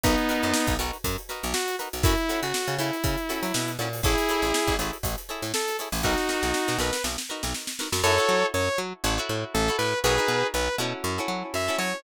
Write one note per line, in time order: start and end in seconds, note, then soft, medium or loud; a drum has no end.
0.03 0.16 B1 medium
0.03 0.74 B3 medium
0.03 0.74 D#4 medium
0.03 0.14 D#4 medium
0.03 0.14 F#4 medium
0.03 0.14 A#4 medium
0.03 0.14 B4 medium
0.03 kick medium
0.03 closed hi-hat medium
0.18 closed hi-hat soft
0.29 0.48 D#4 medium
0.29 0.48 F#4 medium
0.29 0.48 A#4 medium
0.29 0.48 B4 medium
0.29 closed hi-hat medium
0.43 0.53 F#2 medium
0.43 closed hi-hat soft
0.54 snare medium
0.67 0.77 B1 medium
0.67 kick medium
0.67 closed hi-hat medium
0.79 0.91 B1 medium
0.79 0.97 D#4 medium
0.79 0.97 F#4 medium
0.79 0.97 A#4 medium
0.79 0.97 B4 medium
0.79 closed hi-hat medium
0.93 closed hi-hat soft
1.04 1.17 F#2 medium
1.04 kick medium
1.04 closed hi-hat medium
1.18 closed hi-hat soft
1.29 1.47 D#4 medium
1.29 1.47 F#4 medium
1.29 1.47 A#4 medium
1.29 1.47 B4 medium
1.29 snare soft
1.29 closed hi-hat medium
1.43 1.54 B1 medium
1.43 closed hi-hat medium
1.54 1.76 F#4 medium
1.54 snare medium
1.68 closed hi-hat medium
1.79 1.89 D#4 medium
1.79 1.89 F#4 medium
1.79 1.89 A#4 medium
1.79 1.89 B4 medium
1.79 closed hi-hat medium
1.93 2.03 B1 medium
1.93 closed hi-hat medium
2.03 2.16 F#2 medium
2.03 2.14 C#4 loud
2.03 2.40 E4 medium
2.03 2.14 E4 medium
2.03 2.14 F#4 medium
2.03 2.14 A4 medium
2.03 kick medium
2.03 closed hi-hat medium
2.18 closed hi-hat soft
2.29 2.47 C#4 medium
2.29 2.47 E4 medium
2.29 2.47 F#4 medium
2.29 2.47 A4 medium
2.29 snare soft
2.29 closed hi-hat medium
2.42 2.53 C#3 medium
2.42 2.75 F#4 medium
2.42 closed hi-hat soft
2.54 snare medium
2.67 2.78 C#3 medium
2.67 closed hi-hat soft
2.78 2.91 C#3 medium
2.78 2.97 C#4 medium
2.78 3.71 E4 medium
2.78 2.97 E4 medium
2.78 2.97 F#4 medium
2.78 2.97 A4 medium
2.78 closed hi-hat medium
2.93 closed hi-hat soft
3.04 3.16 C#3 medium
3.04 kick medium
3.04 closed hi-hat medium
3.18 closed hi-hat soft
3.29 3.47 C#4 medium
3.29 3.47 E4 medium
3.29 3.47 F#4 medium
3.29 3.47 A4 medium
3.29 closed hi-hat medium
3.42 3.52 F#3 medium
3.42 closed hi-hat medium
3.54 3.77 B2 medium
3.54 snare medium
3.68 closed hi-hat medium
3.79 4.01 A#2 medium
3.79 3.89 C#4 medium
3.79 3.89 E4 medium
3.79 3.89 F#4 medium
3.79 3.89 A4 medium
3.79 snare soft
3.79 closed hi-hat medium
3.93 open hi-hat soft
4.03 4.16 A1 medium
4.03 4.74 E4 medium
4.03 4.14 E4 medium
4.03 4.74 G#4 medium
4.03 4.14 G#4 medium
4.03 4.14 A4 loud
4.03 4.14 C#5 medium
4.03 kick medium
4.03 closed hi-hat medium
4.18 closed hi-hat medium
4.29 4.47 E4 medium
4.29 4.47 G#4 medium
4.29 4.47 A4 medium
4.29 4.47 C#5 medium
4.29 snare soft
4.29 closed hi-hat medium
4.42 4.52 A1 medium
4.42 closed hi-hat medium
4.54 snare medium
4.67 4.77 A1 medium
4.67 kick medium
4.67 closed hi-hat soft
4.79 4.91 A1 medium
4.79 4.97 E4 medium
4.79 4.97 G#4 medium
4.79 4.97 A4 medium
4.79 4.97 C#5 medium
4.79 closed hi-hat medium
4.93 closed hi-hat medium
5.03 5.16 A1 medium
5.03 kick medium
5.03 closed hi-hat medium
5.18 closed hi-hat medium
5.29 5.47 E4 medium
5.29 5.47 G#4 medium
5.29 5.47 A4 medium
5.29 5.47 C#5 medium
5.29 closed hi-hat soft
5.42 5.52 A2 medium
5.42 snare soft
5.42 closed hi-hat soft
5.54 5.77 A4 medium
5.54 snare medium
5.68 snare soft
5.68 closed hi-hat medium
5.79 5.89 E4 medium
5.79 5.89 G#4 medium
5.79 5.89 A4 medium
5.79 5.89 C#5 medium
5.79 snare soft
5.79 closed hi-hat medium
5.92 6.02 A1 medium
5.92 open hi-hat soft
6.03 6.16 B1 medium
6.03 6.77 D#4 medium
6.03 6.14 D#4 medium
6.03 6.77 F#4 medium
6.03 6.14 F#4 medium
6.03 6.14 A#4 loud
6.03 6.14 B4 medium
6.03 kick medium
6.17 snare soft
6.29 6.47 D#4 medium
6.29 6.47 F#4 medium
6.29 6.47 A#4 medium
6.29 6.47 B4 medium
6.29 snare medium
6.43 6.53 B1 medium
6.43 snare medium
6.54 snare medium
6.68 6.79 B2 medium
6.68 snare medium
6.78 6.91 B1 medium
6.78 6.97 D#4 medium
6.78 6.97 F#4 medium
6.78 6.97 A#4 medium
6.78 6.97 B4 medium
6.78 7.02 B4 soft
6.78 snare medium
6.93 snare medium
7.04 7.16 B1 medium
7.04 snare medium
7.18 snare medium
7.29 7.47 D#4 medium
7.29 7.47 F#4 medium
7.29 7.47 A#4 medium
7.29 7.47 B4 medium
7.43 7.54 B1 medium
7.43 snare medium
7.54 snare medium
7.67 snare medium
7.79 7.89 D#4 medium
7.79 7.89 F#4 medium
7.79 7.89 A#4 medium
7.79 7.89 B4 medium
7.79 snare medium
7.92 8.02 F#2 medium
7.92 snare medium
8.03 8.18 F#2 loud
8.03 8.15 E4 loud
8.03 8.15 F#4 loud
8.03 8.46 A4 medium
8.03 8.15 A4 loud
8.03 8.46 C#5 medium
8.03 8.15 C#5 loud
8.18 8.57 E4 medium
8.18 8.57 F#4 medium
8.18 8.57 A4 medium
8.18 8.57 C#5 medium
8.29 8.44 F#3 medium
8.54 8.69 F#2 medium
8.54 8.78 C#5 medium
8.78 8.93 F#3 medium
9.04 9.19 A1 loud
9.04 9.15 E4 medium
9.04 9.15 F#4 medium
9.04 9.15 A4 loud
9.04 9.15 C#5 loud
9.18 9.57 E4 medium
9.18 9.57 F#4 loud
9.18 9.57 A4 medium
9.18 9.57 C#5 medium
9.29 9.44 A2 medium
9.54 9.70 A1 medium
9.54 9.76 A4 medium
9.68 9.97 E4 medium
9.68 9.97 F#4 medium
9.68 9.97 A4 medium
9.68 9.97 C#5 medium
9.78 9.94 A2 medium
9.78 9.99 B4 medium
10.04 10.19 B1 medium
10.04 10.15 D#4 loud
10.04 10.15 F#4 loud
10.04 10.47 G#4 medium
10.04 10.15 A#4 loud
10.04 10.47 B4 medium
10.04 10.15 B4 loud
10.18 10.57 D#4 medium
10.18 10.57 F#4 medium
10.18 10.57 A#4 medium
10.18 10.57 B4 medium
10.28 10.43 B2 medium
10.54 10.69 B1 medium
10.54 10.76 B4 medium
10.78 10.93 B2 medium
10.78 11.15 C#4 loud
10.78 11.15 E4 loud
10.78 11.15 F#4 loud
10.78 11.15 A4 loud
11.04 11.19 F#2 medium
11.18 11.57 C#4 medium
11.18 11.57 E4 medium
11.18 11.57 F#4 medium
11.18 11.57 A4 medium
11.28 11.43 F#3 medium
11.54 11.69 F#2 medium
11.54 11.76 E5 medium
11.68 11.97 C#4 medium
11.68 11.97 E4 medium
11.68 11.97 F#4 medium
11.68 11.97 A4 medium
11.78 11.93 F#3 medium
11.78 12.00 C#5 medium